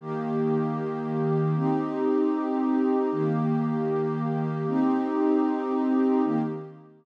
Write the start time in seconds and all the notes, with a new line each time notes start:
0.01 D#3 A#3 G4
1.56 C4 D#4 G4
3.12 D#3 A#3 G4
4.67 C4 D#4 G4
6.24 D#3 A#3 G4